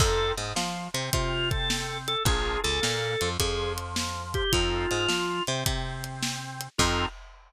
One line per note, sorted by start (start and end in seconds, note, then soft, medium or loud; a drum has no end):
0.00 0.32 F2 loud
0.00 0.34 C4 medium
0.00 0.34 D#4 medium
0.00 0.34 F4 medium
0.00 0.32 A4 loud
0.00 0.34 A4 medium
0.00 kick loud
0.00 crash loud
0.37 0.53 G#2 medium
0.37 0.53 G#3 medium
0.37 snare medium
0.37 closed hi-hat medium
0.55 0.88 F3 medium
0.55 0.88 F4 medium
0.55 snare loud
0.94 1.10 C3 medium
0.94 1.10 C4 medium
0.94 closed hi-hat medium
1.11 2.16 C3 medium
1.11 2.13 C4 medium
1.11 1.49 F4 loud
1.11 kick loud
1.11 closed hi-hat loud
1.51 1.98 A4 loud
1.51 kick loud
1.51 closed hi-hat medium
1.70 snare loud
2.08 2.23 A4 loud
2.08 closed hi-hat medium
2.25 2.58 A#1 medium
2.25 2.61 D4 medium
2.25 2.61 F4 medium
2.25 2.61 G#4 medium
2.25 2.60 G#4 loud
2.25 2.61 A#4 medium
2.25 kick loud
2.25 closed hi-hat loud
2.64 2.80 C#2 medium
2.64 2.79 C#3 medium
2.64 3.29 A4 loud
2.64 snare medium
2.64 closed hi-hat medium
2.81 3.16 A#2 medium
2.81 3.14 A#3 medium
2.81 snare loud
3.21 3.37 F2 medium
3.21 3.38 F3 medium
3.21 closed hi-hat medium
3.40 4.42 F2 medium
3.40 4.43 F3 medium
3.40 3.72 G#4 medium
3.40 kick loud
3.40 closed hi-hat loud
3.78 closed hi-hat medium
3.96 snare loud
4.34 4.52 G4 loud
4.34 kick loud
4.34 closed hi-hat medium
4.52 4.86 F2 medium
4.52 4.87 C4 medium
4.52 4.87 D#4 medium
4.52 5.43 F4 loud
4.52 4.87 F4 medium
4.52 4.87 A4 medium
4.52 kick loud
4.52 closed hi-hat loud
4.91 5.07 G#2 medium
4.91 5.07 G#3 medium
4.91 snare medium
4.91 closed hi-hat medium
5.08 5.41 F3 medium
5.08 5.41 F4 medium
5.08 snare loud
5.47 5.64 C3 medium
5.47 5.64 C4 medium
5.47 closed hi-hat medium
5.65 6.68 C3 medium
5.65 6.67 C4 medium
5.65 kick loud
5.65 closed hi-hat loud
6.04 closed hi-hat medium
6.23 snare loud
6.61 closed hi-hat medium
6.78 7.06 F2 loud
6.78 7.06 C4 loud
6.78 7.06 D#4 loud
6.78 7.05 F4 loud
6.78 7.06 F4 loud
6.78 7.06 A4 loud
6.78 kick loud
6.78 crash loud